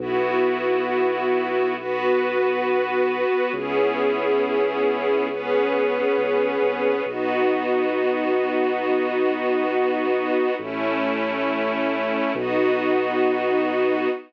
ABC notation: X:1
M:6/8
L:1/16
Q:3/8=68
K:Bmix
V:1 name="String Ensemble 1"
[B,EF]12 | [B,FB]12 | [B,CEG]12 | [B,CGB]12 |
[B,DF]12- | [B,DF]12 | [A,CE]12 | [B,DF]12 |]
V:2 name="Synth Bass 2" clef=bass
B,,,12- | B,,,12 | C,,12- | C,,6 C,,3 =C,,3 |
B,,,12- | B,,,12 | A,,,12 | B,,,12 |]